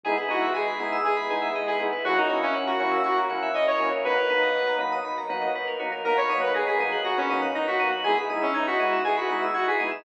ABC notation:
X:1
M:4/4
L:1/16
Q:1/4=120
K:B
V:1 name="Lead 2 (sawtooth)"
G z F2 G4 G4 z G z2 | F D2 C z F3 F z3 d c2 z | B6 z10 | A c2 B G G3 F C2 z D F2 z |
G z2 C D F3 G F2 z F G2 z |]
V:2 name="Drawbar Organ"
[G,B,DE]2 [G,B,DE]4 [G,B,DE]4 [G,B,DE]4 [G,B,DE]2 | [F,A,CE]2 [F,A,CE]4 [F,A,CE]4 [F,A,CE]4 [F,A,CE]2 | [F,A,B,D]2 [F,A,B,D]4 [F,A,B,D]4 [F,A,B,D]4 [F,A,B,D]2 | [F,A,B,D]2 [F,A,B,D]4 [F,A,B,D]4 [F,A,B,D]4 [F,A,B,D]2 |
[G,B,DE]2 [G,B,DE]4 [G,B,DE]4 [G,B,DE]4 [G,B,DE]2 |]
V:3 name="Electric Piano 2"
G B d e g b d' e' d' b g e d B G B | F A c e f a c' e' c' a f e c A F A | F A B d f a b d' b a f d B A F A | a b d' f' a' b' d'' f'' a b d' f' a' b' d'' f'' |
g b d' e' g' b' d'' e'' g b d' e' g' b' d'' e'' |]
V:4 name="Synth Bass 2" clef=bass
G,,,2 G,,,2 G,,,2 G,,,2 G,,,2 G,,,2 G,,,2 G,,,2 | F,,2 F,,2 F,,2 F,,2 F,,2 F,,2 F,,2 F,,2 | B,,,2 B,,,2 B,,,2 B,,,2 B,,,2 B,,,2 B,,,2 B,,,2 | B,,,2 B,,,2 B,,,2 B,,,2 B,,,2 B,,,2 B,,,2 B,,,2 |
G,,,2 G,,,2 G,,,2 G,,,2 G,,,2 G,,,2 G,,,2 G,,,2 |]
V:5 name="Pad 2 (warm)"
[G,B,DE]16 | [F,A,CE]16 | [F,A,B,D]16 | [F,A,B,D]16 |
[G,B,DE]16 |]